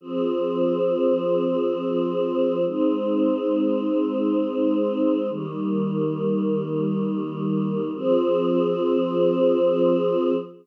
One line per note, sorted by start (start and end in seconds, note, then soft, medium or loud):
0.01 2.63 F3 medium
0.01 2.63 C4 medium
0.01 2.63 G#4 medium
2.65 5.27 G#3 medium
2.65 5.27 C4 medium
2.65 5.27 D#4 medium
5.29 7.91 D#3 medium
5.29 7.91 G3 medium
5.29 7.91 A#3 medium
7.94 10.32 F3 loud
7.94 10.32 C4 loud
7.94 10.32 G#4 loud